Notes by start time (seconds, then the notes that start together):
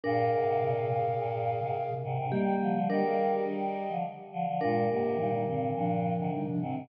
0.03 G2 A#2 D4 G#4 A#4 F5
0.33 G#2 C3
0.47 G#2 C3
0.61 G2 A#2 C3
0.88 G2 A#2 C3
1.18 G2 A#2
1.60 G#2 C3
1.91 C3
2.04 G#2 C3
2.18 G#2 C3
2.31 D#3 G3 A#3 G4
2.61 D3 F3
2.74 D3 F3
2.89 D#3 G3 D4 G4 A#4 D#5
3.04 G#4 F5
3.18 D#3 G3
3.32 G4 D#5
3.48 D#3 G3
3.89 D3 F3
4.32 D3 F3
4.46 D3 F3
4.61 G2 A#2 G#3 D4 F4 A#4
4.89 G#2 C3 A#3 G4
5.03 G#2 C3
5.17 G2 A#2 D#3 G3 D#4
5.32 G3 D#4
5.47 G2 A#2 D3 D#3 C4
5.74 G2 A#2 F3 D4
6.19 G#2 C3 D3
6.32 G3 D#4
6.47 C3 F3 D4
6.61 G#2 C3 D#3 C4
6.75 G#2 C3